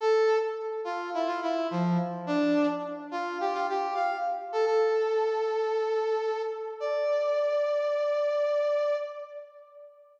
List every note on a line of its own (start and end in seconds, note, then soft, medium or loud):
0.01 0.37 A4 loud
0.85 1.10 F4 loud
1.14 1.28 E4 loud
1.27 1.40 F4 loud
1.42 1.67 E4 loud
1.71 1.98 F3 loud
2.27 2.67 D4 loud
3.11 3.38 F4 loud
3.40 3.54 G4 loud
3.53 3.67 F4 loud
3.69 3.94 G4 loud
3.94 4.17 F5 loud
4.52 4.65 A4 loud
4.66 6.42 A4 loud
6.80 8.96 D5 loud